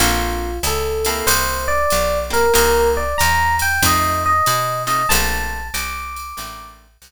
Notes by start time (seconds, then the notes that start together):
0.00 A#1 A#3 C4 D4 F4 A4, ride
0.63 C#2 A4, hi-hat pedal, ride
1.05 A#3 C4 E4 G4 A4, ride
1.27 C2 C5, ride
1.68 D5
1.90 B1, hi-hat pedal, ride
2.30 A#3 C4 E4 G4 A#4, ride
2.54 C2 A#3 C4 D#4 G4 A#4, ride
2.97 D5
3.18 E2 A#5, hi-hat pedal, ride
3.59 G5, ride
3.82 F2 A3 C4 D#4 F4 D#5, kick, ride
4.26 D#5
4.46 B2, hi-hat pedal, ride
4.87 A3 C4 D#4 F4 D#5, ride
5.09 A#1 A3 A#3 C4 D4 A5, ride
5.74 C2 D6, hi-hat pedal, ride
6.16 ride
6.37 A1 A3 A#3 C4 D4, ride
7.02 C2, hi-hat pedal, ride